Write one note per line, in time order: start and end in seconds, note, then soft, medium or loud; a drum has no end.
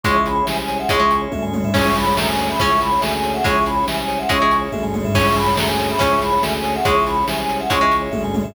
0.04 0.43 C#2 loud
0.04 0.81 G#3 medium
0.04 0.19 C#4 medium
0.04 0.47 C#4 medium
0.04 0.47 E4 medium
0.04 0.19 E4 loud
0.04 0.47 G#4 medium
0.04 0.19 G#4 loud
0.04 0.16 C#5 loud
0.04 0.21 C#6 medium
0.04 kick loud
0.04 closed hi-hat loud
0.15 0.25 E5 medium
0.25 0.38 G#5 medium
0.25 0.44 B5 medium
0.25 closed hi-hat medium
0.35 0.46 C#5 medium
0.46 0.85 C2 medium
0.46 0.90 G#3 medium
0.46 0.90 C#4 medium
0.46 0.90 G#4 medium
0.46 0.56 E5 medium
0.46 0.57 G#5 medium
0.46 snare medium
0.56 0.67 G#5 medium
0.56 0.77 G#5 medium
0.68 0.79 C#5 medium
0.68 closed hi-hat medium
0.79 0.89 E5 medium
0.79 0.88 F#5 medium
0.89 1.28 C#2 loud
0.89 0.99 G#3 medium
0.89 1.04 C#4 loud
0.89 1.32 C#4 medium
0.89 1.04 E4 loud
0.89 1.32 E4 medium
0.89 1.04 G#4 loud
0.89 1.32 G#4 medium
0.89 1.00 C#5 loud
0.89 1.15 C#6 medium
0.89 kick loud
0.89 closed hi-hat loud
0.99 1.50 G#3 medium
0.99 1.11 E5 medium
1.11 1.21 G#5 medium
1.11 closed hi-hat medium
1.22 1.32 C#5 medium
1.32 1.70 D2 medium
1.32 1.74 G#3 medium
1.32 1.73 C#4 medium
1.32 1.73 G#4 medium
1.32 1.43 E5 medium
1.32 kick medium
1.32 high tom medium
1.42 1.53 G#5 medium
1.42 floor tom medium
1.53 1.64 C#5 medium
1.53 high tom medium
1.64 1.75 E5 medium
1.64 floor tom loud
1.74 2.13 C#2 loud
1.74 2.45 C#4 medium
1.74 2.16 C#4 medium
1.74 1.90 C#4 medium
1.74 2.16 E4 medium
1.74 1.90 E4 loud
1.74 2.16 G#4 medium
1.74 1.90 G#4 loud
1.74 1.85 C#5 loud
1.74 1.95 C#6 medium
1.74 kick loud
1.74 crash loud
1.85 1.96 E5 medium
1.95 2.06 G#5 medium
1.95 2.15 B5 medium
1.95 closed hi-hat medium
2.07 2.17 C#5 medium
2.17 2.55 D2 medium
2.17 2.60 G#3 medium
2.17 2.60 C#4 loud
2.17 2.60 G#4 loud
2.17 2.28 E5 medium
2.17 2.27 A#5 medium
2.17 snare loud
2.28 2.39 G#5 medium
2.28 2.48 G#5 medium
2.37 2.48 C#5 medium
2.37 closed hi-hat medium
2.50 2.60 E5 medium
2.50 2.59 B5 medium
2.59 2.98 C#2 loud
2.59 2.75 C#4 loud
2.59 3.02 C#4 medium
2.59 2.99 C#4 medium
2.59 2.75 E4 loud
2.59 3.03 E4 medium
2.59 2.75 G#4 loud
2.59 3.02 G#4 medium
2.59 2.70 C#5 loud
2.59 2.80 C#6 medium
2.59 kick loud
2.59 closed hi-hat loud
2.70 2.81 E5 medium
2.80 2.91 G#5 medium
2.80 3.00 B5 medium
2.80 closed hi-hat medium
2.92 3.02 C#5 medium
3.01 3.41 D2 loud
3.01 3.45 G#3 medium
3.01 3.44 C#4 medium
3.01 3.44 G#4 medium
3.01 3.12 E5 medium
3.01 3.11 G#5 medium
3.01 snare loud
3.13 3.23 G#5 medium
3.13 3.32 G#5 medium
3.24 3.36 C#5 medium
3.24 closed hi-hat medium
3.34 3.44 E5 medium
3.34 3.44 F#5 medium
3.44 3.83 C#2 loud
3.44 4.20 G#3 medium
3.44 3.60 C#4 medium
3.44 3.86 C#4 medium
3.44 3.87 E4 medium
3.44 3.60 E4 loud
3.44 3.86 G#4 medium
3.44 3.60 G#4 loud
3.44 3.56 C#5 loud
3.44 3.63 C#6 medium
3.44 kick loud
3.44 closed hi-hat loud
3.55 3.65 E5 medium
3.66 3.78 G#5 medium
3.66 3.84 B5 medium
3.66 closed hi-hat medium
3.76 3.87 C#5 medium
3.87 4.25 C2 medium
3.87 4.29 G#3 medium
3.87 4.29 C#4 medium
3.87 4.29 G#4 medium
3.87 3.99 E5 medium
3.87 3.97 G#5 medium
3.87 snare medium
3.99 4.10 G#5 medium
3.99 4.19 G#5 medium
4.08 4.19 C#5 medium
4.08 closed hi-hat medium
4.19 4.29 E5 medium
4.19 4.29 F#5 medium
4.29 4.68 C#2 loud
4.29 4.38 G#3 medium
4.29 4.72 C#4 medium
4.29 4.45 C#4 loud
4.29 4.72 E4 medium
4.29 4.45 E4 loud
4.29 4.72 G#4 medium
4.29 4.45 G#4 loud
4.29 4.41 C#5 loud
4.29 4.56 C#6 medium
4.29 kick loud
4.29 closed hi-hat loud
4.40 4.93 G#3 medium
4.40 4.51 E5 medium
4.51 4.63 G#5 medium
4.51 closed hi-hat medium
4.61 4.71 C#5 medium
4.72 5.11 D2 medium
4.72 5.15 G#3 medium
4.72 5.14 C#4 medium
4.72 5.14 G#4 medium
4.72 4.83 E5 medium
4.72 kick medium
4.72 high tom medium
4.83 4.94 G#5 medium
4.83 floor tom medium
4.94 5.04 C#5 medium
4.94 high tom medium
5.04 5.15 E5 medium
5.04 floor tom loud
5.14 5.53 C#2 loud
5.14 5.57 C#4 medium
5.14 5.86 C#4 medium
5.14 5.30 C#4 medium
5.14 5.57 E4 medium
5.14 5.30 E4 loud
5.14 5.57 G#4 medium
5.14 5.30 G#4 loud
5.14 5.25 C#5 loud
5.14 5.35 C#6 medium
5.14 kick loud
5.14 crash loud
5.26 5.37 E5 medium
5.36 5.47 G#5 medium
5.36 5.54 B5 medium
5.36 closed hi-hat medium
5.47 5.57 C#5 medium
5.56 5.96 D2 medium
5.56 6.00 G#3 medium
5.56 6.00 C#4 loud
5.56 6.00 G#4 loud
5.56 5.68 E5 medium
5.56 5.65 A#5 medium
5.56 snare loud
5.68 5.88 G#5 medium
5.68 5.78 G#5 medium
5.78 5.89 C#5 medium
5.78 closed hi-hat medium
5.90 6.00 E5 medium
5.90 5.99 B5 medium
5.99 6.38 C#2 loud
5.99 6.37 C#4 medium
5.99 6.15 C#4 loud
5.99 6.42 C#4 medium
5.99 6.15 E4 loud
5.99 6.42 E4 medium
5.99 6.42 G#4 medium
5.99 6.15 G#4 loud
5.99 6.12 C#5 loud
5.99 6.19 C#6 medium
5.99 kick loud
5.99 closed hi-hat loud
6.11 6.21 E5 medium
6.21 6.32 G#5 medium
6.21 6.42 B5 medium
6.21 closed hi-hat medium
6.32 6.43 C#5 medium
6.42 6.81 D2 loud
6.42 6.84 G#3 medium
6.42 6.84 C#4 medium
6.42 6.84 G#4 medium
6.42 6.53 E5 medium
6.42 6.53 G#5 medium
6.42 snare loud
6.54 6.65 G#5 medium
6.54 6.73 G#5 medium
6.63 6.74 C#5 medium
6.63 closed hi-hat medium
6.74 6.86 E5 medium
6.74 6.84 F#5 medium
6.84 7.24 C#2 loud
6.84 7.61 G#3 medium
6.84 7.00 C#4 medium
6.84 7.27 C#4 medium
6.84 7.27 E4 medium
6.84 7.00 E4 loud
6.84 7.27 G#4 medium
6.84 7.00 G#4 loud
6.84 6.95 C#5 loud
6.84 7.03 C#6 medium
6.84 kick loud
6.84 closed hi-hat loud
6.95 7.05 E5 medium
7.06 7.17 G#5 medium
7.06 7.24 B5 medium
7.06 closed hi-hat medium
7.16 7.27 C#5 medium
7.27 7.66 C2 medium
7.27 7.69 G#3 medium
7.27 7.69 C#4 medium
7.27 7.69 G#4 medium
7.27 7.39 E5 medium
7.27 7.36 G#5 medium
7.27 snare medium
7.39 7.58 G#5 medium
7.39 7.50 G#5 medium
7.49 7.59 C#5 medium
7.49 closed hi-hat medium
7.60 7.70 E5 medium
7.60 7.70 F#5 medium
7.70 8.09 C#2 loud
7.70 7.78 G#3 medium
7.70 8.12 C#4 medium
7.70 7.85 C#4 loud
7.70 8.12 E4 medium
7.70 7.85 E4 loud
7.70 8.12 G#4 medium
7.70 7.85 G#4 loud
7.70 7.81 C#5 loud
7.70 7.96 C#6 medium
7.70 kick loud
7.70 closed hi-hat loud
7.81 8.32 G#3 medium
7.81 7.92 E5 medium
7.92 8.03 G#5 medium
7.92 closed hi-hat medium
8.02 8.12 C#5 medium
8.11 8.51 D2 medium
8.11 8.54 G#3 medium
8.11 8.54 C#4 medium
8.11 8.54 G#4 medium
8.11 8.22 E5 medium
8.11 kick medium
8.11 high tom medium
8.24 8.35 G#5 medium
8.24 floor tom medium
8.34 8.44 C#5 medium
8.34 high tom medium
8.44 8.54 E5 medium
8.44 floor tom loud